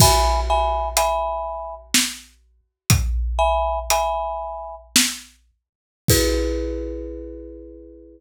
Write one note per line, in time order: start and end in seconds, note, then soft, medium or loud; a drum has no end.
0.00 0.40 E5 loud
0.00 0.40 G#5 loud
0.00 0.40 B5 loud
0.00 kick loud
0.00 crash loud
0.50 0.89 E5 medium
0.50 0.89 G#5 loud
0.50 0.89 B5 medium
0.97 1.75 E5 loud
0.97 1.75 G#5 medium
0.97 1.75 B5 loud
0.97 closed hi-hat loud
1.94 snare loud
2.90 kick loud
2.90 closed hi-hat loud
3.39 3.79 E5 loud
3.39 3.79 G#5 loud
3.39 3.79 B5 medium
3.90 4.75 E5 medium
3.90 4.75 G#5 medium
3.90 4.75 B5 medium
3.90 closed hi-hat loud
4.96 snare loud
6.08 8.20 E4 medium
6.08 8.20 G#4 loud
6.08 8.20 B4 loud
6.08 kick loud
6.08 crash loud